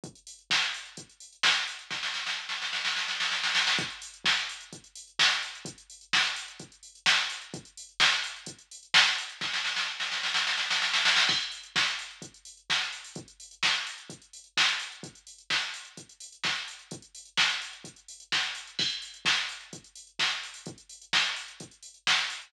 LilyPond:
\new DrumStaff \drummode { \time 4/4 \tempo 4 = 128 <hh bd>16 hh16 hho16 hh16 <bd sn>16 hh16 hho16 hh16 <hh bd>16 hh16 hho16 hh16 <bd sn>16 hh16 hho16 hh16 | <bd sn>16 sn16 sn16 sn16 r16 sn16 sn16 sn16 sn16 sn16 sn16 sn16 sn16 sn16 sn16 sn16 | <hh bd>16 hh16 hho16 hh16 <bd sn>16 hh16 hho16 hh16 <hh bd>16 hh16 hho16 hh16 <bd sn>16 hh16 hho16 hh16 | <hh bd>16 hh16 hho16 hh16 <bd sn>16 hh16 hho16 hh16 <hh bd>16 hh16 hho16 hh16 <bd sn>16 hh16 hho16 hh16 |
<hh bd>16 hh16 hho16 hh16 <bd sn>16 hh16 hho16 hh16 <hh bd>16 hh16 hho16 hh16 <bd sn>16 hh16 hho16 hh16 | <bd sn>16 sn16 sn16 sn16 r16 sn16 sn16 sn16 sn16 sn16 sn16 sn16 sn16 sn16 sn16 sn16 | <cymc bd>16 hh16 hho16 hh16 <bd sn>16 hh16 hho16 hh16 <hh bd>16 hh16 hho16 hh16 <bd sn>16 hh16 hho16 hho16 | <hh bd>16 hh16 hho16 hh16 <bd sn>16 hh16 hho16 hh16 <hh bd>16 hh16 hho16 hh16 <bd sn>16 hh16 hho16 hh16 |
<hh bd>16 hh16 hho16 hh16 <bd sn>16 hh16 hho16 hh16 <hh bd>16 hh16 hho16 hh16 <bd sn>16 hh16 hho16 hh16 | <hh bd>16 hh16 hho16 hh16 <bd sn>16 hh16 hho16 hh16 <hh bd>16 hh16 hho16 hh16 <bd sn>16 hh16 hho16 hh16 | <cymc bd>16 hh16 hho16 hh16 <bd sn>16 hh16 hho16 hh16 <hh bd>16 hh16 hho16 hh16 <bd sn>16 hh16 hho16 hho16 | <hh bd>16 hh16 hho16 hh16 <bd sn>16 hh16 hho16 hh16 <hh bd>16 hh16 hho16 hh16 <bd sn>16 hh16 hho16 hh16 | }